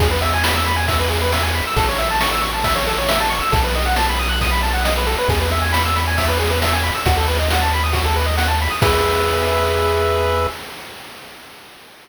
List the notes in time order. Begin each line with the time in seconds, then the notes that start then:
0.00 E2 G#4, kick, crash
0.11 B4
0.22 E5, ride
0.34 G#5
0.44 B5, snare
0.56 E6
0.66 B5, ride
0.76 G#5
0.88 E5, kick, ride
0.99 B4
1.10 G#4, ride
1.22 B4
1.32 E5, snare
1.43 G#5
1.54 B5, ride
1.67 E6
1.76 A1 A4, kick, ride
1.89 C#5
1.98 E5, ride
2.10 A5
2.21 C#6, snare
2.32 E6
2.41 C#6, ride
2.54 A5
2.64 E5, kick, ride
2.76 C#5
2.86 A4, ride
2.98 C#5
3.09 E5, snare
3.20 A5
3.30 C#6, ride
3.41 E6
3.52 B1 A4, kick, ride
3.64 B4
3.75 D#5, ride
3.86 F#5
3.96 A5, snare
4.09 B5
4.19 D#6, ride
4.29 F#6
4.41 D#6, kick, ride
4.51 B5
4.63 A5, ride
4.74 F#5
4.84 D#5, snare
4.97 B4
5.07 A4, ride
5.18 B4
5.28 E2 G#4, kick, ride
5.41 B4
5.51 E5, ride
5.62 G#5
5.73 B5, snare
5.85 E6
5.96 B5, ride
6.07 G#5
6.18 E5, kick, ride
6.28 B4
6.39 G#4, ride
6.50 B4
6.62 E5, snare
6.73 G#5
6.83 B5, ride
6.95 E6
7.06 D#2 F#4, kick, ride
7.17 A4
7.27 B4, ride
7.39 D#5
7.50 F#5, snare
7.61 A5
7.72 B5, ride
7.84 D#6
7.93 F#4, kick, ride
8.05 A4
8.15 B4, ride
8.26 D#5
8.37 F#5, snare
8.48 A5
8.60 B5, ride
8.70 D#6
8.82 E2 G#4 B4 E5, kick, crash